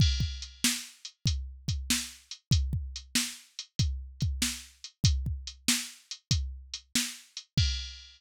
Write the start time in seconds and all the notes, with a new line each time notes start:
0.00 kick, crash
0.20 kick
0.42 closed hi-hat
0.64 snare
1.05 closed hi-hat
1.26 kick, closed hi-hat
1.68 kick, closed hi-hat
1.90 snare
2.31 closed hi-hat
2.51 kick, closed hi-hat
2.73 kick
2.96 closed hi-hat
3.15 snare
3.59 closed hi-hat
3.79 kick, closed hi-hat
4.21 kick, closed hi-hat
4.42 snare
4.84 closed hi-hat
5.04 kick, closed hi-hat
5.26 kick
5.47 closed hi-hat
5.68 snare
6.11 closed hi-hat
6.31 kick, closed hi-hat
6.74 closed hi-hat
6.95 snare
7.37 closed hi-hat
7.58 kick, crash